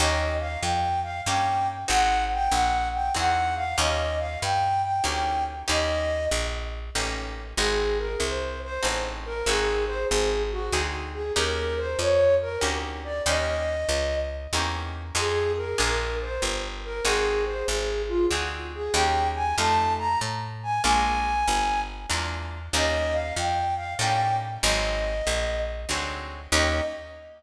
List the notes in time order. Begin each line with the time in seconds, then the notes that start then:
0.00 D#2 A#3 C#4 D#4 G4 D#5
0.40 F5
0.62 F2 G5
1.03 F5
1.26 G2 A#3 C#4 D#4 G4 G5
1.88 G#1 C4 D#4 F#4 G#4 F#5
2.34 G5
2.51 A#1 F#5
2.94 G5
3.14 E2 C4 D#4 F#4 G#4 F#5
3.56 F5
3.78 D#2 A#3 C#4 D#4 G4 D#5
4.19 F5
4.42 G2 G5
4.84 G5
5.04 D2 A#3 C#4 D#4 G4
5.08 G5
5.68 D#2 A#3 C#4 D#4 G4 D#5
6.31 A#1
6.95 A1 A#3 C#4 D#4 G4
7.57 G#1 C4 D#4 F#4 G#4
7.99 A#4
8.20 C2 C5
8.64 C5
8.83 A1 C4 D#4 F#4 G#4
9.26 A#4
9.46 G#1 C4 D#4 F#4 G#4
9.87 C5
10.10 G#1 G#4
10.51 F#4
10.73 D2 C4 D#4 F#4 G#4
11.14 G#4
11.36 D#2 A#3 C#4 D#4 G4 A#4
11.78 C5
11.99 F2 C#5
12.42 A#4
12.61 D2 A#3 C#4 D#4 G4
13.04 D5
13.26 D#2 A#3 C#4 D#4 G4 D#5
13.89 C#2
14.53 E2 A#3 C#4 D#4 G4
15.15 F2 C4 D#4 F4 G#4
15.57 A#4
15.78 A#1 A#3 D4 F4 G#4 A#4
16.22 C5
16.42 G1
16.85 A#4
17.05 G#1 C4 D#4 F#4 G#4
17.46 C5
17.68 G#1 G#4
18.08 F4
18.31 D2 C4 D#4 F#4 G#4
18.75 G#4
18.94 D#2 A#3 C#4 D#4 G4 G5
19.35 G#5
19.57 F2 A3 D#4 F4 G4 A5
19.99 A#5
20.21 A2
20.63 G#5
20.82 A#1 G#3 A#3 D4 F4 G#5
21.48 G1
22.10 E2 G#3 A#3 D4 F4
22.73 D#2 G3 A#3 C#4 D#4 D#5
23.13 F5
23.36 F2 G5
23.76 F5
23.99 A2 G3 A#3 C#4 D#4 G5
24.63 G#1 F#3 G#3 C4 D#4 D#5
25.27 A#1
25.89 D2 F#3 G#3 C4 D#4
26.52 D#2 A#3 C#4 D#4 G4 D#5